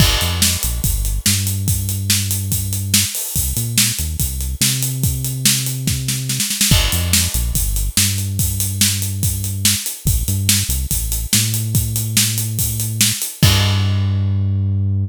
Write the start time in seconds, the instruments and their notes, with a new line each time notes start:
0.00 synth bass 1 G1, kick, crash
0.21 synth bass 1 F2, closed hi-hat
0.42 snare
0.63 synth bass 1 A#1, closed hi-hat
0.84 synth bass 1 G1, kick, closed hi-hat
1.05 closed hi-hat
1.26 synth bass 1 G2, snare
1.47 closed hi-hat
1.68 kick, closed hi-hat
1.89 closed hi-hat
2.10 snare
2.31 closed hi-hat
2.52 kick, closed hi-hat
2.73 closed hi-hat
2.94 snare
3.15 open hi-hat
3.35 synth bass 1 C2, kick, closed hi-hat
3.56 synth bass 1 A#2, closed hi-hat
3.78 snare
3.99 synth bass 1 D#2, closed hi-hat
4.20 synth bass 1 C2, kick, closed hi-hat
4.41 closed hi-hat
4.61 synth bass 1 C3, snare
4.83 closed hi-hat
5.03 kick, closed hi-hat
5.24 closed hi-hat
5.45 snare
5.66 closed hi-hat
5.87 kick, snare
6.08 snare
6.29 snare
6.40 snare
6.50 snare
6.61 snare
6.71 synth bass 1 G1, kick, crash
6.92 synth bass 1 F2, closed hi-hat
7.13 snare
7.34 synth bass 1 A#1, closed hi-hat
7.54 synth bass 1 G1, kick, closed hi-hat
7.76 closed hi-hat
7.97 synth bass 1 G2, snare
8.18 closed hi-hat
8.39 kick, closed hi-hat
8.60 closed hi-hat
8.81 snare
9.02 closed hi-hat
9.23 kick, closed hi-hat
9.44 closed hi-hat
9.65 snare
9.86 closed hi-hat
10.05 synth bass 1 A1, kick, closed hi-hat
10.28 synth bass 1 G2, closed hi-hat
10.49 snare
10.69 synth bass 1 C2, closed hi-hat
10.91 synth bass 1 A1, kick, closed hi-hat
11.12 closed hi-hat
11.33 synth bass 1 A2, snare
11.54 closed hi-hat
11.75 kick, closed hi-hat
11.96 closed hi-hat
12.17 snare
12.38 closed hi-hat
12.59 kick, closed hi-hat
12.80 closed hi-hat
13.01 snare
13.22 closed hi-hat
13.43 synth bass 1 G2, kick, crash